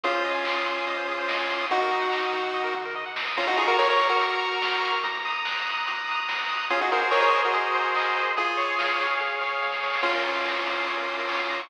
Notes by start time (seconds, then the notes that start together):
0.04 C2 C#4 F4 G#4, kick, closed hi-hat
0.15 C5
0.25 C3 D#5, open hi-hat
0.35 G#5
0.45 C2 C6, kick, clap
0.57 D#6
0.66 C3 C6, open hi-hat
0.76 G#5
0.87 C2 D#5, kick, closed hi-hat
0.97 C5
1.08 C3 G#4, open hi-hat
1.19 C5
1.28 C2 D#5, kick, snare
1.39 G#5
1.49 C3 C6, open hi-hat
1.60 D#6
1.70 D#2 D#4 F#4, kick, closed hi-hat
1.81 A#4
1.91 D#3 D#5, open hi-hat
2.02 F#5
2.12 D#2 A#5, kick, clap
2.23 D#6
2.33 D#3 A#5, open hi-hat
2.44 F#5
2.53 D#2 D#5, kick, floor tom
2.64 A#4
2.74 D#3 F#4, mid tom
2.85 A#4
2.95 C3 D#5
3.06 F#5
3.16 B2 A#5, snare
3.27 D#6
3.36 A#1 C#4 F4 A#5, kick, crash
3.47 D#4 F#4, closed hi-hat
3.57 A#1 F4 G#4 C#6, open hi-hat
3.68 F#4 A#4, closed hi-hat
3.78 A#1 A#4 C#5 F6, kick, snare
3.89 A#4 C#5, closed hi-hat
4.00 A#1 C#6, open hi-hat
4.09 F#4 A#4, closed hi-hat
4.20 A#1 A#5, kick, closed hi-hat
4.31 closed hi-hat
4.40 A#1 C#6
4.51 closed hi-hat
4.62 A#1 F6, kick, snare
4.72 closed hi-hat
4.83 A#1 C#6, open hi-hat
4.93 closed hi-hat
5.03 D#2 A#5, kick, closed hi-hat
5.14 closed hi-hat
5.25 D#2 D#6, open hi-hat
5.35 closed hi-hat
5.45 D#2 F#6, kick, snare
5.56 closed hi-hat
5.66 D#2 D#6, open hi-hat
5.77 closed hi-hat
5.86 D#2 A#5, kick, closed hi-hat
5.97 closed hi-hat
6.07 D#2 D#6, open hi-hat
6.18 closed hi-hat
6.28 F#2 F#6, kick, snare
6.39 closed hi-hat
6.49 G#1 D#6, open hi-hat
6.60 closed hi-hat
6.70 C#4 F4 G#4, kick, closed hi-hat
6.81 D#4 F#4, closed hi-hat
6.91 G#1 F#4 A#4 C5, open hi-hat
7.01 F#4 A#4, closed hi-hat
7.11 G#1 A#4 C#5 D#5, kick, clap
7.22 A#4 C#5, closed hi-hat
7.33 G#1 C5, open hi-hat
7.43 F#4 A#4, closed hi-hat
7.53 G#1 G#4, kick, closed hi-hat
7.64 closed hi-hat
7.74 G#1 C5, open hi-hat
7.85 closed hi-hat
7.95 G#1 D#5, kick, clap
8.06 closed hi-hat
8.15 G#1 C5, open hi-hat
8.27 closed hi-hat
8.37 C#2 F4 G#4, kick, closed hi-hat
8.48 closed hi-hat
8.57 C#2 C#5, open hi-hat
8.68 closed hi-hat
8.78 C#2 F5, kick, snare
8.89 closed hi-hat
8.99 C#2 C#5, open hi-hat
9.10 closed hi-hat
9.20 C#2 G#4, kick, snare
9.41 C#2 C#5, snare
9.62 C#2 F5, snare
9.72 snare
9.83 C#2 C#5, snare
9.93 snare
10.03 A#1 C#4 F4, kick, crash
10.15 A#4
10.24 A#2 C#5, open hi-hat
10.36 F5
10.45 A#1 A#5, kick, snare
10.55 C#6
10.66 A#2 A#5, open hi-hat
10.78 F5
10.87 A#1 C#5, kick, closed hi-hat
10.97 A#4
11.08 A#2 F4, open hi-hat
11.18 A#4
11.29 A#1 C#5, kick, clap
11.39 F5
11.49 A#2 A#5, open hi-hat
11.60 C#6